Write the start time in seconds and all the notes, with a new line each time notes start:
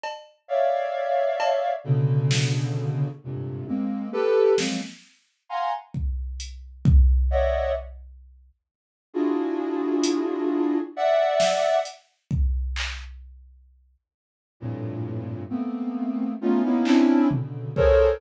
0.03 cowbell
0.48 C#5 D5 E5 F5
1.40 cowbell
1.84 B2 C#3 D3
2.31 snare
3.23 F2 G2 G#2 A#2 C3
3.67 G#3 A#3 C4, high tom
4.12 G4 A4 B4
4.58 F3 F#3 G#3 A#3 C4, snare
5.49 F5 F#5 G#5 A#5 C6
5.94 kick
6.40 closed hi-hat
6.85 kick
7.30 C#5 D5 D#5 E5 F#5
9.13 D4 E4 F4 F#4 G#4
10.03 closed hi-hat
10.96 D5 E5 F#5
11.40 snare
11.85 closed hi-hat
12.31 kick
12.76 clap
14.60 F2 G2 A2 A#2
15.49 A3 A#3 B3 C4
16.41 A3 B3 C#4 D#4 F4
16.64 A#3 B3 C#4 D#4 E4
16.85 C4 C#4 D4 E4, clap
17.30 B2 C#3 D3, floor tom
17.76 G#4 A4 A#4 C5 C#5, kick